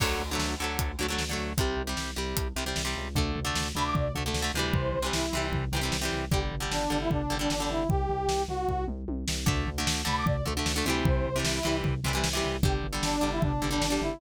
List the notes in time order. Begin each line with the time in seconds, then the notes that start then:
0.00 D2 D3 F#3 A3, kick, crash
0.20 D2
0.31 D3 F#3 A3
0.38 D2, snare
0.60 D2 D3 F#3 A3
0.79 D2, kick, closed hi-hat
0.99 D2 D3 F#3 A3
1.08 D3 F#3 A3
1.19 D2, snare
1.29 D3 F#3 A3
1.38 D2
1.58 C2 C3 G3, kick, closed hi-hat
1.77 C2
1.87 C3 G3
1.97 C2, snare
2.16 C2 C3 G3
2.36 C2, kick, closed hi-hat
2.56 C2 C3 G3
2.66 C3 G3
2.76 C2, snare
2.85 C3 G3
2.97 C#2
3.15 D2 D3 A3, kick, floor tom
3.35 D2, floor tom
3.45 D3 A3
3.55 D2, snare
3.75 D2 D3 A3 B5, floor tom
3.85 D6
3.95 D2 D5, kick, floor tom
4.15 D2 D3 A3, floor tom
4.26 D3 A3
4.34 D2, snare
4.42 D3 A3
4.54 D2 C3 E3, floor tom
4.59 G3
4.73 C2 C5, kick, floor tom
4.94 C2, floor tom
5.02 C3 E3 G3
5.13 C2 E4, snare
5.33 C2 C3 E3, floor tom
5.37 G3
5.52 C2, kick, floor tom
5.72 C2 C3 E3, floor tom
5.76 G3
5.81 C3 E3 G3
5.92 C2, snare
6.01 C3 E3 G3
6.12 C2, floor tom
6.31 G1 D3 G3 G4, kick, floor tom
6.51 G1, floor tom
6.60 D3 G3
6.71 G1 D4, snare
6.90 G1 D3 G3, floor tom
7.01 E4
7.10 G1 D4, kick, floor tom
7.30 G1 D3 G3, floor tom
7.39 D3 G3 D4
7.50 G1, snare
7.60 D3 G3
7.69 G1 E4, floor tom
7.89 C2 G4, kick, floor tom
8.09 C2, floor tom
8.28 C2, snare
8.48 C2 F#4, floor tom
8.68 C2, kick, floor tom
8.88 C2, mid tom
9.08 C2, high tom
9.28 C2, snare
9.46 D2 D3 A3, kick, floor tom
9.67 D2, floor tom
9.78 D3 A3
9.87 D2, snare
10.05 D2 D3 A3 B5, floor tom
10.16 D6
10.25 D2 D5, kick, floor tom
10.45 D2 D3 A3, floor tom
10.57 D3 A3
10.66 D2, snare
10.76 D3 A3
10.85 D2 C3 E3, floor tom
10.90 G3
11.05 C2 C5, kick, floor tom
11.25 C2, floor tom
11.36 C3 E3 G3
11.44 C2 E4, snare
11.63 C2 C3 E3 G3, floor tom
11.83 C2, kick, floor tom
12.04 C2 C3 E3, floor tom
12.08 G3
12.13 C3 E3 G3
12.24 C2, snare
12.33 C3 E3 G3
12.44 C2, floor tom
12.63 G1 D3 G3 G4, kick, floor tom
12.83 G1, floor tom
12.93 D3 G3
13.03 G1 D4, snare
13.21 G1 D3 G3, floor tom
13.32 E4
13.42 G1 D4, kick, floor tom
13.62 G1 D3 G3, floor tom
13.71 D3 G3 D4
13.81 G1, snare
13.90 D3 G3
14.01 G1 E4, floor tom